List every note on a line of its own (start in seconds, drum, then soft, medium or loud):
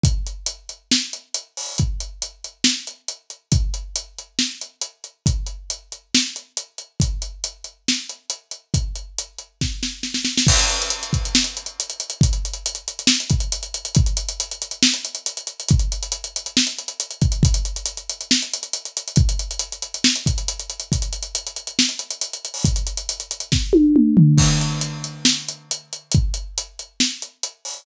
0.04 kick loud
0.04 closed hi-hat loud
0.27 closed hi-hat medium
0.46 closed hi-hat loud
0.69 closed hi-hat medium
0.91 snare loud
1.13 closed hi-hat medium
1.34 closed hi-hat loud
1.57 open hi-hat medium
1.78 kick medium
1.78 closed hi-hat medium
2.00 closed hi-hat medium
2.22 closed hi-hat medium
2.44 closed hi-hat medium
2.64 snare loud
2.87 closed hi-hat medium
3.08 closed hi-hat medium
3.30 closed hi-hat medium
3.52 kick loud
3.52 closed hi-hat loud
3.74 closed hi-hat medium
3.96 closed hi-hat loud
4.18 closed hi-hat medium
4.39 snare medium
4.61 closed hi-hat medium
4.81 closed hi-hat medium
5.04 closed hi-hat medium
5.26 kick medium
5.26 closed hi-hat medium
5.46 closed hi-hat medium
5.70 closed hi-hat medium
5.92 closed hi-hat medium
6.15 snare loud
6.36 closed hi-hat medium
6.57 closed hi-hat medium
6.78 closed hi-hat medium
7.00 kick medium
7.00 closed hi-hat loud
7.22 closed hi-hat medium
7.44 closed hi-hat medium
7.64 closed hi-hat medium
7.88 snare medium
8.09 closed hi-hat medium
8.30 closed hi-hat medium
8.51 closed hi-hat medium
8.74 kick medium
8.74 closed hi-hat medium
8.95 closed hi-hat medium
9.18 closed hi-hat medium
9.38 closed hi-hat medium
9.61 kick medium
9.61 snare medium
9.83 snare medium
10.03 snare medium
10.14 snare medium
10.25 snare medium
10.38 snare loud
10.47 kick loud
10.47 crash loud
10.59 closed hi-hat medium
10.69 closed hi-hat medium
10.82 closed hi-hat medium
10.90 closed hi-hat loud
11.03 closed hi-hat medium
11.13 kick medium
11.13 closed hi-hat medium
11.25 closed hi-hat medium
11.35 snare loud
11.44 closed hi-hat medium
11.57 closed hi-hat medium
11.66 closed hi-hat medium
11.80 closed hi-hat loud
11.90 closed hi-hat medium
12.00 closed hi-hat medium
12.10 closed hi-hat medium
12.21 kick loud
12.21 closed hi-hat loud
12.33 closed hi-hat medium
12.45 closed hi-hat medium
12.53 closed hi-hat medium
12.66 closed hi-hat loud
12.75 closed hi-hat medium
12.88 closed hi-hat medium
12.99 closed hi-hat medium
13.07 snare loud
13.20 closed hi-hat medium
13.30 kick medium
13.30 closed hi-hat medium
13.40 closed hi-hat medium
13.52 closed hi-hat loud
13.63 closed hi-hat medium
13.74 closed hi-hat medium
13.85 closed hi-hat medium
13.95 kick loud
13.95 closed hi-hat loud
14.06 closed hi-hat medium
14.17 closed hi-hat medium
14.29 closed hi-hat medium
14.40 closed hi-hat loud
14.51 closed hi-hat medium
14.62 closed hi-hat medium
14.71 closed hi-hat medium
14.83 snare loud
14.94 closed hi-hat medium
15.05 closed hi-hat medium
15.15 closed hi-hat medium
15.26 closed hi-hat loud
15.37 closed hi-hat medium
15.47 closed hi-hat medium
15.60 closed hi-hat medium
15.68 kick loud
15.68 closed hi-hat loud
15.79 closed hi-hat medium
15.92 closed hi-hat medium
16.03 closed hi-hat medium
16.12 closed hi-hat loud
16.24 closed hi-hat medium
16.36 closed hi-hat medium
16.46 closed hi-hat medium
16.57 snare loud
16.67 closed hi-hat medium
16.78 closed hi-hat medium
16.88 closed hi-hat medium
17.00 closed hi-hat loud
17.11 closed hi-hat medium
17.21 kick loud
17.21 closed hi-hat medium
17.32 closed hi-hat medium
17.43 kick loud
17.43 closed hi-hat loud
17.54 closed hi-hat medium
17.65 closed hi-hat medium
17.76 closed hi-hat medium
17.86 closed hi-hat loud
17.97 closed hi-hat medium
18.09 closed hi-hat medium
18.21 closed hi-hat medium
18.31 snare loud
18.42 closed hi-hat medium
18.53 closed hi-hat medium
18.63 closed hi-hat medium
18.73 closed hi-hat loud
18.85 closed hi-hat medium
18.97 closed hi-hat medium
19.08 closed hi-hat medium
19.16 kick loud
19.16 closed hi-hat medium
19.29 closed hi-hat medium
19.39 closed hi-hat medium
19.51 closed hi-hat medium
19.59 closed hi-hat loud
19.72 closed hi-hat medium
19.82 closed hi-hat medium
19.94 closed hi-hat medium
20.04 snare loud
20.16 closed hi-hat medium
20.26 kick medium
20.26 closed hi-hat medium
20.38 closed hi-hat medium
20.48 closed hi-hat loud
20.60 closed hi-hat medium
20.70 closed hi-hat medium
20.80 closed hi-hat medium
20.92 kick medium
20.92 closed hi-hat loud
21.02 closed hi-hat medium
21.13 closed hi-hat medium
21.23 closed hi-hat medium
21.35 closed hi-hat loud
21.47 closed hi-hat medium
21.56 closed hi-hat medium
21.67 closed hi-hat medium
21.79 snare loud
21.89 closed hi-hat medium
21.99 closed hi-hat medium
22.11 closed hi-hat medium
22.21 closed hi-hat loud
22.33 closed hi-hat medium
22.45 closed hi-hat medium
22.54 open hi-hat medium
22.65 kick loud
22.65 closed hi-hat loud
22.76 closed hi-hat medium
22.87 closed hi-hat medium
22.97 closed hi-hat medium
23.09 closed hi-hat loud
23.20 closed hi-hat medium
23.31 closed hi-hat medium
23.40 closed hi-hat medium
23.52 kick medium
23.52 snare medium
23.73 high tom medium
23.96 mid tom medium
24.17 floor tom loud
24.38 kick medium
24.38 crash loud
24.61 closed hi-hat medium
24.81 closed hi-hat medium
25.04 closed hi-hat medium
25.25 snare loud
25.48 closed hi-hat medium
25.71 closed hi-hat loud
25.93 closed hi-hat medium
26.12 kick loud
26.12 closed hi-hat loud
26.34 closed hi-hat medium
26.58 closed hi-hat loud
26.79 closed hi-hat medium
27.00 snare loud
27.22 closed hi-hat medium
27.43 closed hi-hat loud
27.65 open hi-hat medium